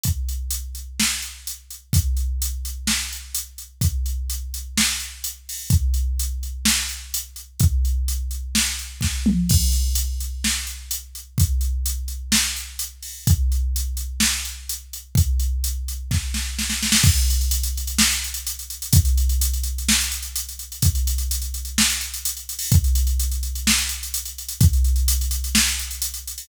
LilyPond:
\new DrumStaff \drummode { \time 4/4 \tempo 4 = 127 <hh bd>8 hh8 hh8 hh8 sn8 hh8 hh8 hh8 | <hh bd>8 hh8 hh8 hh8 sn8 hh8 hh8 hh8 | <hh bd>8 hh8 hh8 hh8 sn8 hh8 hh8 hho8 | <hh bd>8 hh8 hh8 hh8 sn8 hh8 hh8 hh8 |
<hh bd>8 hh8 hh8 hh8 sn8 hh8 <bd sn>8 toml8 | <cymc bd>8 hh8 hh8 hh8 sn8 hh8 hh8 hh8 | <hh bd>8 hh8 hh8 hh8 sn8 hh8 hh8 hho8 | <hh bd>8 hh8 hh8 hh8 sn8 hh8 hh8 hh8 |
<hh bd>8 hh8 hh8 hh8 <bd sn>8 sn8 sn16 sn16 sn16 sn16 | <cymc bd>16 hh16 hh16 hh16 hh16 hh16 hh16 hh16 sn16 hh16 hh16 hh16 hh16 hh16 hh16 hh16 | <hh bd>16 hh16 hh16 hh16 hh16 hh16 hh16 hh16 sn16 hh16 hh16 hh16 hh16 hh16 hh16 hh16 | <hh bd>16 hh16 hh16 hh16 hh16 hh16 hh16 hh16 sn16 hh16 hh16 hh16 hh16 hh16 hh16 hho16 |
<hh bd>16 hh16 hh16 hh16 hh16 hh16 hh16 hh16 sn16 hh16 hh16 hh16 hh16 hh16 hh16 hh16 | <hh bd>16 hh16 hh16 hh16 hh16 hh16 hh16 hh16 sn16 hh16 hh16 hh16 hh16 hh16 hh16 hho16 | }